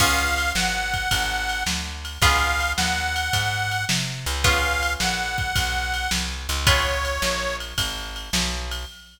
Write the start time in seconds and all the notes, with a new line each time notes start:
0.00 C#2 B3 C#4 F4 G#4 F5, kick, crash
0.38 ride
0.55 G#1 F#5, snare
0.94 kick, ride
1.11 G#1, kick, ride
1.49 ride
1.66 D2, snare
2.05 ride
2.22 C#2 B3 C#4 F4 G#4 F5, kick, ride
2.60 ride
2.77 D#2 F#5, snare
3.16 ride
3.33 G#2, kick, ride
3.71 ride
3.89 C3, snare
4.26 C#2, ride
4.44 B3 C#4 F4 G#4 F5, kick, ride
4.83 ride
5.00 A#1 F#5, snare
5.38 kick, ride
5.56 B1, kick, ride
5.94 ride
6.11 C2, snare
6.49 C#2, ride
6.67 B3 C#4 F4 G#4 C#5, kick, ride
7.05 ride
7.22 A#1, snare
7.60 ride
7.78 G#1, kick, ride
8.16 ride
8.33 B1, snare
8.71 ride